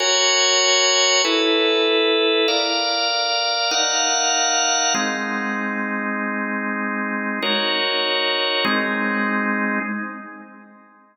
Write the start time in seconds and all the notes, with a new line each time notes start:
0.00 F#4 A#4 C#5 G#5
1.25 E4 A4 B4
2.48 A#4 D5 F5
3.71 D#4 A#4 F5 F#5
4.94 G#3 C4 D#4
7.42 D#4 F#4 A#4 C#5
8.65 G#3 C4 D#4